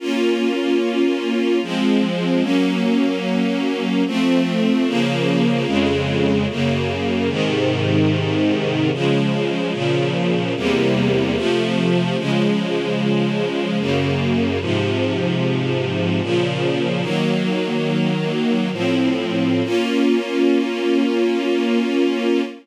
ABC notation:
X:1
M:3/4
L:1/8
Q:1/4=74
K:Bbm
V:1 name="String Ensemble 1"
[B,DF]4 [F,A,C]2 | [G,B,D]4 [F,=A,C]2 | [D,F,B,]2 [F,,D,A,]2 [G,,D,B,]2 | [A,,C,E,]4 [D,F,A,]2 |
[B,,D,F,]2 [=E,,C,=G,B,]2 [C,F,=A,]2 | [D,F,A,]4 [G,,D,B,]2 | [A,,C,F,]4 [B,,D,F,]2 | "^rit." [E,G,B,]4 [=A,,F,C]2 |
[B,DF]6 |]